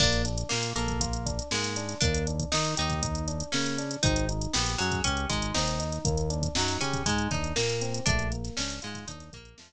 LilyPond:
<<
  \new Staff \with { instrumentName = "Acoustic Guitar (steel)" } { \time 4/4 \key bes \mixolydian \tempo 4 = 119 d'8 r8 bes8 bes4. aes4 | d'8 r8 ees'8 ees'4. des'4 | ees'8 r8 b8 ges8 des'8 aes8 ees'4 | r4 ges8 des'8 aes8 ees'8 bes4 |
d'8 r8 des'8 aes8 ees'8 bes8 f4 | }
  \new Staff \with { instrumentName = "Electric Piano 1" } { \time 4/4 \key bes \mixolydian bes8 d'8 f'8 a'8 f'8 d'8 bes8 d'8 | bes8 d'8 ees'8 g'8 ees'8 d'8 bes8 d'8 | c'8 ees'8 g'8 aes'8 g'8 ees'8 c'8 ees'8 | bes8 d'8 ees'8 g'8 ees'8 d'8 bes8 c'8 |
a8 bes8 d'8 f'8 d'8 bes8 a8 r8 | }
  \new Staff \with { instrumentName = "Synth Bass 1" } { \clef bass \time 4/4 \key bes \mixolydian bes,,4 bes,8 bes,,4. aes,4 | ees,4 ees8 ees,4. des4 | aes,,4 bes,,8 ges,8 des,8 aes,,8 ees,4 | ees,4 ges,8 des8 aes,8 ees,8 bes,4 |
bes,,4 des,8 aes,8 ees,8 bes,,8 f,4 | }
  \new DrumStaff \with { instrumentName = "Drums" } \drummode { \time 4/4 <cymc bd>16 <hh sn>16 hh16 hh16 sn16 hh16 hh16 <hh bd>16 <hh bd>16 hh16 <hh bd>16 hh16 sn16 hh16 hh16 <hh sn>16 | <hh bd>16 hh16 hh16 <hh bd>16 sn16 <hh sn>16 hh16 <hh bd>16 <hh bd>16 hh16 hh16 hh16 sn16 hh16 hh16 hh16 | <hh bd>16 hh16 hh16 hh16 sn16 hh16 hh16 <hh bd>16 <hh bd>16 hh16 <hh bd>16 hh16 sn16 hh16 hh16 hh16 | <hh bd>16 hh16 hh16 <hh bd>16 sn16 hh16 hh16 <hh bd>16 <hh bd>16 hh16 <hh bd sn>16 hh16 sn16 hh16 hh16 hh16 |
<hh bd>16 hh16 hh16 <hh sn>16 sn16 <hh sn>16 hh16 <hh bd sn>16 <hh bd>16 <hh sn>16 <hh bd>16 hh16 sn16 <hh sn>8. | }
>>